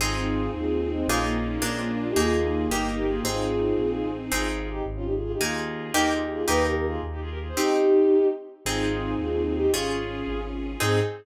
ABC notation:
X:1
M:6/8
L:1/16
Q:3/8=111
K:Ab
V:1 name="Violin"
[FA]6 [FA]3 [FA] [A,C]2 | [DF]2 [A,C] [B,D] [B,D]2 D [A,C] ^C [B,=D] [DF] [EG] | [FA]6 [EG]3 [GB] [FA]2 | [FA]10 z2 |
[FA]2 [FA] [FA] [EG]2 z [DF] [EG] [FA] [FA] [EG] | [FA]6 [GB]2 [FA] [EG] [FA]2 | _c2 [GB] [GB] [FA]2 z [EG] [FA] [GB] [FA] [A=c] | [EG]8 z4 |
[FA]6 [FA]3 [FA] [EG]2 | [FA]8 z4 | A6 z6 |]
V:2 name="Orchestral Harp"
[CEA]12 | [B,EFA]6 [B,=DFA]6 | [B,EA]6 [B,EG]6 | [CEA]12 |
[CEA]12 | [B,EA]6 [B,EG]6 | [B,EG]12 | [CEG]12 |
[CEA]12 | [DFA]12 | [CEA]6 z6 |]
V:3 name="String Ensemble 1"
[CEA]12 | [B,EFA]6 [B,=DFA]6 | [B,EA]6 [B,EG]6 | [CEA]12 |
z12 | z12 | z12 | z12 |
[CEA]12 | [DFA]12 | [CEA]6 z6 |]
V:4 name="Acoustic Grand Piano" clef=bass
A,,,6 E,,6 | B,,,6 B,,,6 | E,,6 G,,,6 | A,,,6 B,,,3 =A,,,3 |
A,,,6 A,,,6 | E,,6 E,,6 | E,,6 E,,6 | z12 |
A,,,6 E,,6 | A,,,6 A,,,6 | A,,6 z6 |]